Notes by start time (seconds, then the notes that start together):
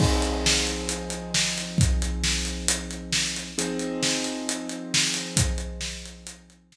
0.00 F3 C4 D#4 G#4, kick, crash
0.22 closed hi-hat
0.46 snare
0.67 closed hi-hat
0.89 closed hi-hat
1.10 closed hi-hat
1.34 snare
1.58 closed hi-hat
1.78 kick, closed hi-hat
2.02 closed hi-hat
2.24 snare
2.45 closed hi-hat
2.68 closed hi-hat
2.91 closed hi-hat
3.12 snare
3.36 closed hi-hat
3.58 F3 C4 D#4 G#4, closed hi-hat
3.79 closed hi-hat
4.03 snare
4.24 closed hi-hat
4.49 closed hi-hat
4.69 closed hi-hat
4.94 snare
5.14 closed hi-hat
5.37 kick, closed hi-hat
5.58 closed hi-hat
5.81 snare
6.06 closed hi-hat
6.27 closed hi-hat
6.50 closed hi-hat
6.72 snare